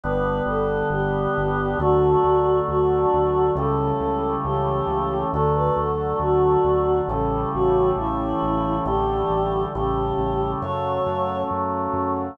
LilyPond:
<<
  \new Staff \with { instrumentName = "Choir Aahs" } { \time 4/4 \key d \major \partial 2 \tempo 4 = 68 b'8 a'8 g'4 | fis'4 fis'4 a'4 g'4 | a'16 b'16 a'8 fis'4 a'8 fis'8 e'4 | g'4 g'4 cis''4 r4 | }
  \new Staff \with { instrumentName = "Drawbar Organ" } { \time 4/4 \key d \major \partial 2 <d g b>2 | <d fis a>2 <cis e g a>2 | <d fis a>2 <cis e g a>2 | <d e g a>4 <cis e g a>4 <cis fis a>2 | }
  \new Staff \with { instrumentName = "Synth Bass 1" } { \clef bass \time 4/4 \key d \major \partial 2 g,,8 g,,8 g,,8 g,,8 | d,8 d,8 d,8 d,8 cis,8 cis,8 cis,8 cis,8 | d,8 d,8 d,8 d,8 a,,8 a,,8 a,,8 a,,8 | a,,8 a,,8 a,,8 a,,8 fis,8 fis,8 fis,8 fis,8 | }
>>